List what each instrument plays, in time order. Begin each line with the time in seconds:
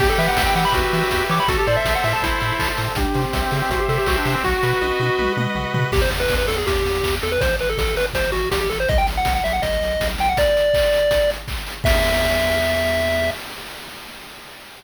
0.00 synth bass 1 E2, lead 1 (square) G4, kick, crash
0.10 lead 1 (square) A4
0.18 synth bass 1 E3, lead 1 (square) B4 E5, open hi-hat
0.28 lead 1 (square) F#5
0.37 synth bass 1 E2, lead 1 (square) E5, kick, snare
0.46 lead 1 (square) G5
0.55 synth bass 1 E3, lead 1 (square) G4 F#5, open hi-hat
0.65 lead 1 (square) B5
0.73 synth bass 1 E2, lead 1 (square) F#4 B4, kick, closed hi-hat
0.93 synth bass 1 E3, lead 1 (square) E5, open hi-hat
1.11 synth bass 1 E2, lead 1 (square) G4, kick, snare
1.29 synth bass 1 E3, lead 1 (square) C#5 D6, open hi-hat
1.40 lead 1 (square) B5
1.48 synth bass 1 A1, lead 1 (square) F#4 A4, kick, closed hi-hat
1.58 lead 1 (square) G4
1.66 synth bass 1 A2, lead 1 (square) C5 D5, open hi-hat
1.76 lead 1 (square) E5
1.85 synth bass 1 A1, lead 1 (square) E5, kick, snare
1.95 lead 1 (square) F#5
2.04 synth bass 1 A2, lead 1 (square) A4 E5, open hi-hat
2.13 lead 1 (square) A5
2.22 synth bass 1 A1, lead 1 (square) E4 C5, kick, closed hi-hat
2.40 synth bass 1 A2, lead 1 (square) E5, open hi-hat
2.59 synth bass 1 A1, lead 1 (square) A4, kick, clap
2.77 synth bass 1 A2, lead 1 (square) C5 C6, open hi-hat
2.88 lead 1 (square) A5
2.95 synth bass 1 C2, lead 1 (square) D4 G4, kick, closed hi-hat
3.14 synth bass 1 C3, lead 1 (square) C5, open hi-hat
3.25 lead 1 (square) C4
3.33 synth bass 1 C2, lead 1 (square) E5, kick, snare
3.42 lead 1 (square) C4
3.51 synth bass 1 C#3, lead 1 (square) C4 G4, open hi-hat
3.62 lead 1 (square) C4
3.70 synth bass 1 C2, lead 1 (square) F#4 C5, kick, closed hi-hat
3.80 lead 1 (square) G4
3.88 synth bass 1 C3, lead 1 (square) A4 E5, open hi-hat
3.98 lead 1 (square) G4
4.06 synth bass 1 C2, lead 1 (square) F#4 G4, kick, clap
4.18 lead 1 (square) D4
4.25 synth bass 1 C3, lead 1 (square) C5, open hi-hat
4.34 lead 1 (square) C4
4.44 synth bass 1 B1, lead 1 (square) F#4, kick, snare
4.63 synth bass 1 B2, lead 1 (square) B4, snare
4.81 synth bass 1 B1, lead 1 (square) D#5, high tom
5.00 synth bass 1 B2, lead 1 (square) F#4, high tom
5.18 synth bass 1 B1, lead 1 (square) B4, mid tom
5.37 synth bass 1 B2, lead 1 (square) D#5, mid tom
5.55 synth bass 1 B1, lead 1 (square) F#4, floor tom
5.74 synth bass 1 B2, lead 1 (square) B4, floor tom
5.92 synth bass 1 E2, lead 1 (square) G4, kick, crash
6.02 lead 1 (square) C5, closed hi-hat
6.11 synth bass 1 E2, open hi-hat
6.20 lead 1 (square) B4, closed hi-hat
6.28 synth bass 1 E2, kick, snare
6.38 lead 1 (square) B4, closed hi-hat
6.48 synth bass 1 E2, lead 1 (square) A4, open hi-hat
6.56 lead 1 (square) G#4, closed hi-hat
6.67 synth bass 1 E2, lead 1 (square) G4, kick, closed hi-hat
6.76 closed hi-hat
6.85 synth bass 1 E2, open hi-hat
6.95 closed hi-hat
7.03 synth bass 1 E2, kick, clap
7.12 closed hi-hat
7.21 synth bass 1 E2, lead 1 (square) A4, open hi-hat
7.31 lead 1 (square) B4, closed hi-hat
7.41 synth bass 1 A1, lead 1 (square) C5, kick, closed hi-hat
7.49 closed hi-hat
7.59 synth bass 1 A1, lead 1 (square) B4, open hi-hat
7.68 lead 1 (square) A4, closed hi-hat
7.78 synth bass 1 A1, lead 1 (square) A4, kick, snare
7.87 closed hi-hat
7.95 synth bass 1 G#1, lead 1 (square) B4, open hi-hat
8.07 closed hi-hat
8.14 synth bass 1 A1, lead 1 (square) C5, kick, closed hi-hat
8.24 closed hi-hat
8.32 synth bass 1 A1, lead 1 (square) F#4, open hi-hat
8.42 closed hi-hat
8.51 synth bass 1 A1, lead 1 (square) G4, kick, snare
8.60 lead 1 (square) G4, closed hi-hat
8.69 synth bass 1 A1, lead 1 (square) A4, open hi-hat
8.80 lead 1 (square) C5, closed hi-hat
8.89 synth bass 1 B1, lead 1 (square) D#5, kick, closed hi-hat
8.98 lead 1 (square) G5, closed hi-hat
9.07 synth bass 1 B1, open hi-hat
9.17 lead 1 (square) F#5, closed hi-hat
9.25 synth bass 1 B1, kick, snare
9.35 lead 1 (square) F#5, closed hi-hat
9.44 synth bass 1 B1, lead 1 (square) E5, open hi-hat
9.53 lead 1 (square) F#5, closed hi-hat
9.62 synth bass 1 B1, lead 1 (square) D#5, kick, closed hi-hat
9.73 closed hi-hat
9.81 synth bass 1 B1, open hi-hat
9.90 closed hi-hat
10.00 synth bass 1 B1, kick, snare
10.09 closed hi-hat
10.18 synth bass 1 B1, lead 1 (square) G5, open hi-hat
10.28 lead 1 (square) F#5, closed hi-hat
10.37 lead 1 (square) D5, kick, closed hi-hat
10.46 closed hi-hat
10.57 open hi-hat
10.63 closed hi-hat
10.74 kick, clap
10.83 closed hi-hat
10.93 open hi-hat
11.02 closed hi-hat
11.11 kick, closed hi-hat
11.21 closed hi-hat
11.30 open hi-hat
11.39 closed hi-hat
11.48 kick, clap
11.57 closed hi-hat
11.67 open hi-hat
11.76 closed hi-hat
11.84 synth bass 1 E2, lead 1 (square) E5, kick, crash